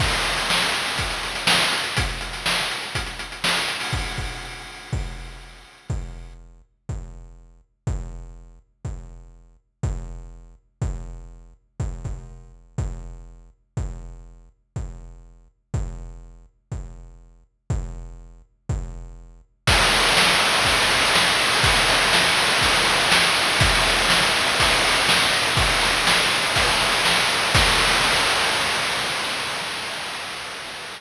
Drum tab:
CC |x---------------|----------------|----------------|----------------|
RD |----------------|----------------|----------------|----------------|
HH |-xxx-xxxxxxx-xxx|xxxx-xxxxxxx-xxo|----------------|----------------|
SD |---oo-------o---|---oo-------o---|----------------|----------------|
BD |o-------o-------|o-------o-------|o-o-----o-------|o-------o-------|

CC |----------------|----------------|----------------|----------------|
RD |----------------|----------------|----------------|----------------|
HH |----------------|----------------|----------------|----------------|
SD |----------------|----------------|----------------|----------------|
BD |o-------o-------|o-------o-------|o-o-----o-------|o-------o-------|

CC |----------------|----------------|x---------------|----------------|
RD |----------------|----------------|-xxx-xxxxxxx-xxx|xxxx-xxxxxxx-xxx|
HH |----------------|----------------|----------------|----------------|
SD |----------------|----------------|----o-------o---|----o-------o---|
BD |o-------o-------|o-------o-------|o-------o-------|o-------o-------|

CC |----------------|----------------|x---------------|
RD |xxxx-xxxxxxx-xxx|xxxx-xxxxxxx-xxx|----------------|
HH |----------------|----------------|----------------|
SD |----o-------o---|----o-------o---|----------------|
BD |o-------o-------|o-------o-------|o---------------|